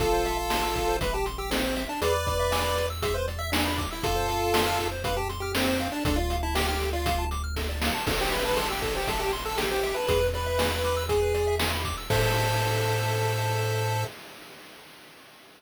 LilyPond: <<
  \new Staff \with { instrumentName = "Lead 1 (square)" } { \time 4/4 \key a \minor \tempo 4 = 119 <f' a'>2 b'16 g'16 r16 g'16 c'8. d'16 | <b' d''>2 e''16 c''16 r16 e''16 d'8. e'16 | <f' a'>2 b'16 g'16 r16 g'16 c'8. d'16 | d'16 f'8 e'16 g'16 g'8 f'8. r4. |
r16 g'16 b'16 b'16 a'16 g'16 a'16 g'16 a'16 g'16 r16 a'16 g'16 g'8 b'16 | b'8 b'4. gis'4 r4 | a'1 | }
  \new Staff \with { instrumentName = "Lead 1 (square)" } { \time 4/4 \key a \minor a'16 c''16 e''16 a''16 c'''16 e'''16 a'16 c''16 e''16 a''16 c'''16 e'''16 a'16 c''16 e''16 a''16 | gis'16 b'16 d''16 e''16 gis''16 b''16 d'''16 e'''16 gis'16 b'16 d''16 e''16 gis''16 b''16 d'''16 e'''16 | a'16 c''16 f''16 a''16 c'''16 f'''16 a'16 c''16 f''16 a''16 c'''16 f'''16 a'16 c''16 f''16 a''16 | a'16 d''16 f''16 a''16 d'''16 f'''16 a'16 d''16 f''16 a''16 d'''16 f'''16 a'16 d''16 f''16 a''16 |
a'16 c''16 e''16 a''16 c'''16 e'''16 a'16 c''16 e''16 a''16 c'''16 e'''16 a'16 c''16 e''16 a''16 | gis'16 b'16 d''16 e''16 gis''16 b''16 d'''16 e'''16 gis'16 b'16 d''16 e''16 gis''16 b''16 d'''16 e'''16 | <a' c'' e''>1 | }
  \new Staff \with { instrumentName = "Synth Bass 1" } { \clef bass \time 4/4 \key a \minor a,,1 | e,1 | f,1 | d,1 |
a,,1 | e,1 | a,1 | }
  \new DrumStaff \with { instrumentName = "Drums" } \drummode { \time 4/4 <hh bd>8 hh8 sn8 <hh bd>8 <hh bd>8 hh8 sn8 hh8 | hh8 <hh bd>8 sn8 hh8 <hh bd>8 hh8 sn8 <hh bd>8 | <hh bd>8 hh8 sn8 <hh bd>8 <hh bd>8 hh8 sn8 hh8 | <hh bd>8 hh8 sn8 hh8 <hh bd>8 hh8 <bd sn>8 sn8 |
<cymc bd>8 hh8 hh8 <hh bd>8 <hh bd>8 hh8 sn8 hh8 | <hh bd>8 hh8 sn8 hh8 <hh bd>8 hh8 sn8 <hh bd>8 | <cymc bd>4 r4 r4 r4 | }
>>